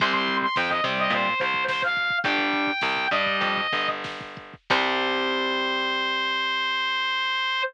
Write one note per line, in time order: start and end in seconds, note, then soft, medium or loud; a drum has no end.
0.00 0.49 C2 medium
0.00 0.46 G3 loud
0.00 0.46 C4 loud
0.00 0.13 C6 medium
0.00 kick loud
0.00 crash medium
0.13 0.37 C6 medium
0.13 kick medium
0.28 kick medium
0.28 closed hi-hat medium
0.42 0.56 C6 medium
0.42 kick medium
0.56 0.81 F2 medium
0.56 0.70 G5 medium
0.56 kick medium
0.56 snare loud
0.69 0.83 D#5 medium
0.69 kick medium
0.84 1.08 C3 medium
0.84 1.29 G3 loud
0.84 1.29 C4 loud
0.84 kick medium
0.84 closed hi-hat medium
0.98 1.12 D#5 medium
0.98 kick medium
1.10 1.34 A#2 medium
1.10 1.39 C5 medium
1.10 kick medium
1.10 closed hi-hat medium
1.26 kick medium
1.40 2.13 C2 medium
1.40 1.64 C5 medium
1.40 kick medium
1.40 closed hi-hat medium
1.54 kick medium
1.68 1.82 C5 medium
1.68 kick medium
1.68 snare loud
1.82 2.18 F5 medium
1.82 kick medium
1.96 kick medium
1.96 closed hi-hat medium
2.10 kick medium
2.24 2.73 G1 medium
2.24 2.71 G3 loud
2.24 2.71 D4 loud
2.24 3.07 G5 medium
2.24 kick loud
2.24 closed hi-hat medium
2.38 kick medium
2.53 kick medium
2.53 closed hi-hat medium
2.67 kick medium
2.81 3.08 C2 medium
2.81 kick medium
2.81 snare loud
2.96 kick medium
3.11 3.37 G2 medium
3.11 3.61 G3 loud
3.11 3.61 D4 loud
3.11 3.88 D#5 medium
3.11 kick medium
3.11 closed hi-hat medium
3.26 kick medium
3.41 3.67 F2 medium
3.41 kick medium
3.41 closed hi-hat loud
3.57 kick medium
3.73 4.55 G1 medium
3.73 kick medium
3.73 closed hi-hat medium
3.88 kick medium
4.04 kick medium
4.04 snare medium
4.21 kick medium
4.37 kick medium
4.37 closed hi-hat medium
4.54 kick medium
4.70 7.62 C2 loud
4.70 7.62 G3 loud
4.70 7.62 C4 loud
4.70 7.62 C5 loud
4.70 kick loud
4.70 crash loud